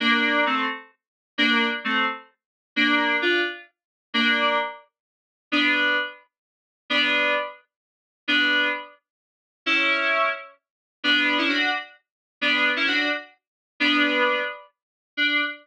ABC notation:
X:1
M:6/8
L:1/16
Q:3/8=87
K:Dm
V:1 name="Electric Piano 2"
[B,D]4 [A,C]2 z6 | [B,D]3 z [A,C]2 z6 | [B,D]4 [DF]2 z6 | [B,D]4 z8 |
[K:D] [B,D]4 z8 | [B,D]4 z8 | [B,D]4 z8 | [CE]6 z6 |
[B,D]3 [CE] [DF]2 z6 | [B,D]3 [CE] [DF]2 z6 | [B,D]6 z6 | D6 z6 |]